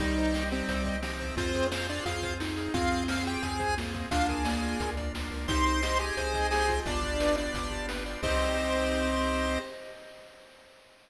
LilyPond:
<<
  \new Staff \with { instrumentName = "Lead 1 (square)" } { \time 4/4 \key c \minor \tempo 4 = 175 <ees ees'>4. <c c'>4. <c c'>4 | <c' c''>4 <c' c''>8 <d' d''>8 <f' f''>4 r4 | <f' f''>4 <f' f''>8 <g' g''>8 <aes' aes''>4 r4 | <f' f''>8 <aes' aes''>2 r4. |
<c'' c'''>4. <aes' aes''>4. <aes' aes''>4 | <d' d''>4. <d' d''>4. r4 | c''1 | }
  \new Staff \with { instrumentName = "Lead 1 (square)" } { \time 4/4 \key c \minor g2. f4 | f'2. ees'4 | c'2. bes4 | d'4 bes4 r2 |
ees'4 g'4 c''2 | d'4 r2. | c'1 | }
  \new Staff \with { instrumentName = "Lead 1 (square)" } { \time 4/4 \key c \minor g'8 c''8 ees''8 g'8 c''8 ees''8 g'8 c''8 | f'8 aes'8 c''8 f'8 aes'8 c''8 f'8 aes'8 | f'8 aes'8 c''8 f'8 aes'8 c''8 f'8 aes'8 | f'8 bes'8 d''8 f'8 bes'8 d''8 f'8 bes'8 |
g'8 c''8 ees''8 g'8 c''8 ees''8 g'8 f'8~ | f'8 g'8 b'8 d''8 f'8 g'8 b'8 d''8 | <g' c'' ees''>1 | }
  \new Staff \with { instrumentName = "Synth Bass 1" } { \clef bass \time 4/4 \key c \minor c,2 c,2 | f,2 f,2 | f,2 f,2 | d,2 d,4 d,8 des,8 |
c,2 c,2 | g,,2 g,,2 | c,1 | }
  \new Staff \with { instrumentName = "Drawbar Organ" } { \time 4/4 \key c \minor <c' ees' g'>1 | <c' f' aes'>1 | <c' f' aes'>1 | <bes d' f'>1 |
<c' ees' g'>1 | <b d' f' g'>1 | <c' ees' g'>1 | }
  \new DrumStaff \with { instrumentName = "Drums" } \drummode { \time 4/4 <hh bd>8 hh8 sn8 hh8 <hh bd>8 <hh bd>8 sn8 <hh bd>8 | <hh bd>8 <hh bd>8 sn8 hh8 <hh bd>8 <hh bd>8 sn8 hh8 | <hh bd>8 hh8 sn8 hh8 <hh bd>8 <hh bd>8 sn8 <hh bd>8 | <hh bd>8 <hh bd>8 sn8 hh8 <hh bd>8 <hh bd>8 sn8 hho8 |
<hh bd>8 hh8 sn8 hh8 <hh bd>8 <hh bd>8 sn8 <hh bd>8 | <hh bd>8 <hh bd>8 sn8 hh8 <hh bd>8 <hh bd>8 sn8 hh8 | <cymc bd>4 r4 r4 r4 | }
>>